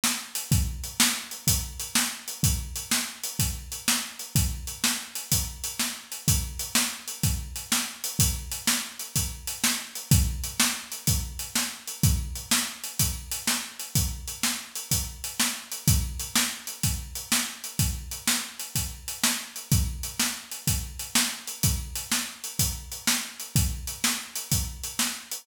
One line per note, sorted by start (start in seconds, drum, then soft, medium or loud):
0.04 snare loud
0.35 closed hi-hat medium
0.52 kick loud
0.52 closed hi-hat medium
0.84 closed hi-hat medium
1.00 snare loud
1.31 closed hi-hat medium
1.47 kick medium
1.47 closed hi-hat loud
1.80 closed hi-hat medium
1.95 snare loud
2.28 closed hi-hat medium
2.43 kick medium
2.43 closed hi-hat medium
2.76 closed hi-hat medium
2.91 snare loud
3.24 closed hi-hat medium
3.39 kick medium
3.39 closed hi-hat medium
3.72 closed hi-hat medium
3.88 snare loud
4.19 closed hi-hat medium
4.36 kick medium
4.36 closed hi-hat medium
4.67 closed hi-hat medium
4.84 snare loud
5.15 closed hi-hat medium
5.32 kick medium
5.32 closed hi-hat loud
5.64 closed hi-hat medium
5.79 snare medium
6.12 closed hi-hat medium
6.28 kick medium
6.28 closed hi-hat loud
6.59 closed hi-hat medium
6.75 snare loud
7.08 closed hi-hat medium
7.23 kick medium
7.23 closed hi-hat medium
7.56 closed hi-hat medium
7.72 snare loud
8.04 closed hi-hat medium
8.19 kick medium
8.19 closed hi-hat loud
8.52 closed hi-hat medium
8.67 snare loud
8.99 closed hi-hat medium
9.16 kick medium
9.16 closed hi-hat medium
9.47 closed hi-hat medium
9.64 snare loud
9.95 closed hi-hat medium
10.11 kick loud
10.11 closed hi-hat loud
10.44 closed hi-hat medium
10.60 snare loud
10.92 closed hi-hat medium
11.07 kick medium
11.07 closed hi-hat medium
11.39 closed hi-hat medium
11.55 snare medium
11.87 closed hi-hat medium
12.03 kick loud
12.03 closed hi-hat medium
12.35 closed hi-hat medium
12.51 snare loud
12.84 closed hi-hat medium
12.99 kick medium
12.99 closed hi-hat medium
13.32 closed hi-hat medium
13.47 snare medium
13.80 closed hi-hat medium
13.95 kick medium
13.95 closed hi-hat medium
14.28 closed hi-hat medium
14.43 snare medium
14.75 closed hi-hat medium
14.91 kick medium
14.91 closed hi-hat medium
15.24 closed hi-hat medium
15.40 snare loud
15.72 closed hi-hat medium
15.88 kick loud
15.88 closed hi-hat medium
16.20 closed hi-hat medium
16.36 snare loud
16.67 closed hi-hat medium
16.83 kick medium
16.83 closed hi-hat medium
17.15 closed hi-hat medium
17.32 snare loud
17.64 closed hi-hat medium
17.79 kick medium
17.79 closed hi-hat medium
18.11 closed hi-hat medium
18.27 snare loud
18.60 closed hi-hat medium
18.75 kick medium
18.75 closed hi-hat medium
19.08 closed hi-hat medium
19.24 snare loud
19.56 closed hi-hat medium
19.72 kick loud
19.72 closed hi-hat medium
20.03 closed hi-hat medium
20.20 snare medium
20.52 closed hi-hat medium
20.67 kick medium
20.67 closed hi-hat medium
20.99 closed hi-hat medium
21.15 snare loud
21.47 closed hi-hat medium
21.63 kick medium
21.63 closed hi-hat medium
21.96 closed hi-hat medium
22.12 snare medium
22.44 closed hi-hat medium
22.59 kick medium
22.59 closed hi-hat medium
22.92 closed hi-hat medium
23.07 snare loud
23.40 closed hi-hat medium
23.56 kick medium
23.56 closed hi-hat medium
23.87 closed hi-hat medium
24.04 snare loud
24.36 closed hi-hat medium
24.52 kick medium
24.52 closed hi-hat medium
24.84 closed hi-hat medium
24.99 snare medium
25.31 closed hi-hat medium